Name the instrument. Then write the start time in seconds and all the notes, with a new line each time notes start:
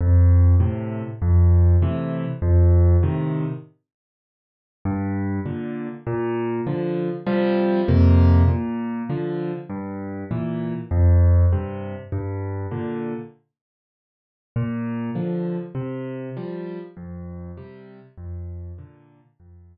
acoustic grand piano
0.01 F2
0.60 A2 C3
1.22 F2
1.82 A2 C3 E3
2.42 F2
3.03 A2 C3 D#3
4.85 G2
5.46 A#2 D3
6.07 A#2
6.67 D3 F3
7.27 C3 F3 G3
7.88 F2 C3 A#3
8.48 A#2
9.10 D3 F3
9.70 G2
10.31 A#2 E3
10.91 F2
11.53 G2 C3
12.12 G2
12.71 A#2 D3
14.56 A#2
15.15 D3 F3
15.75 C3
16.37 F3 G3
16.97 F2
17.57 C3 G3
18.18 F2
18.78 A#2 D3
19.40 F2